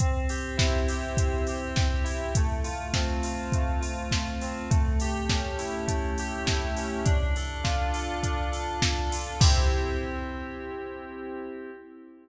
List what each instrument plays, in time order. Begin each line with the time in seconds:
0.00 electric piano 2 C4, kick, closed hi-hat
0.29 electric piano 2 G4, open hi-hat
0.57 electric piano 2 E4, kick, snare
0.88 electric piano 2 G4, open hi-hat
1.17 electric piano 2 C4, kick, closed hi-hat
1.47 electric piano 2 G4, open hi-hat
1.76 electric piano 2 G4, kick, snare
2.04 electric piano 2 E4, open hi-hat
2.35 electric piano 2 A3, kick, closed hi-hat
2.64 electric piano 2 F4, open hi-hat
2.94 electric piano 2 C4, kick, snare
3.23 electric piano 2 F4, open hi-hat
3.52 electric piano 2 A3, kick, closed hi-hat
3.81 electric piano 2 F4, open hi-hat
4.11 electric piano 2 F4, kick, snare
4.41 electric piano 2 C4, open hi-hat
4.70 electric piano 2 A3, kick, closed hi-hat
5.00 electric piano 2 G4, open hi-hat
5.29 electric piano 2 C#4, kick, snare
5.58 electric piano 2 E4, open hi-hat
5.87 electric piano 2 A3, kick, closed hi-hat
6.18 electric piano 2 G4, open hi-hat
6.46 electric piano 2 E4, kick, snare
6.77 electric piano 2 C#4, open hi-hat
7.05 electric piano 2 D4, kick, closed hi-hat
7.36 electric piano 2 A4, open hi-hat
7.64 electric piano 2 F4, kick, snare
7.94 electric piano 2 A4, open hi-hat
8.22 electric piano 2 D4, kick, closed hi-hat
8.52 electric piano 2 A4, open hi-hat
8.82 electric piano 2 A4, kick, snare
9.12 electric piano 2 F4, open hi-hat
9.40 electric piano 2 C4 E4 G4, kick, crash